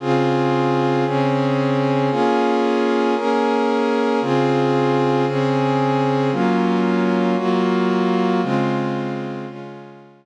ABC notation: X:1
M:4/4
L:1/8
Q:1/4=114
K:Db
V:1 name="Pad 2 (warm)"
[D,CFA]4 [D,CDA]4 | [B,DFA]4 [B,DAB]4 | [D,CFA]4 [D,CDA]4 | [G,B,DF]4 [G,B,FG]4 |
[D,A,CF]4 [D,A,DF]4 |]